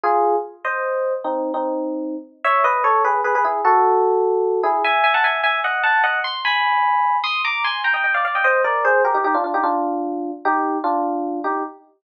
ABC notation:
X:1
M:6/8
L:1/16
Q:3/8=100
K:Eb
V:1 name="Electric Piano 1"
[FA]4 z2 [ce]6 | [CE]3 [CE]7 z2 | [K:E] [ce]2 [Bd]2 [Ac]2 [GB]2 [GB] [GB] [EG]2 | [FA]10 [EG]2 |
[eg]2 [eg] [fa] [eg]2 [eg]2 [df]2 [fa]2 | [df]2 =c'2 [gb]8 | [K:Eb] [c'e']2 [bd']2 [ac']2 [gb] [eg] [eg] [df] [df] [eg] | [ce]2 [Bd]2 [Ac]2 [GB] [EG] [EG] [DF] [DF] [EG] |
[DF]8 [EG]4 | [DF]6 [EG]2 z4 |]